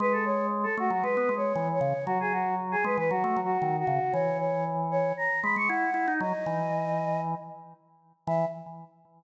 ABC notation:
X:1
M:4/4
L:1/16
Q:1/4=116
K:E
V:1 name="Choir Aahs"
B A c2 z A F F (3B4 c4 c4 | F G F2 z G B B (3F4 F4 F4 | c2 c2 z2 c2 ^a2 b c' f4 | d8 z8 |
e4 z12 |]
V:2 name="Drawbar Organ"
G,6 A, F, G, B, G,2 E,2 C, z | F,6 G, E, F, A, F,2 D,2 C, z | E,8 z2 G, G, E2 E D | F, z E,8 z6 |
E,4 z12 |]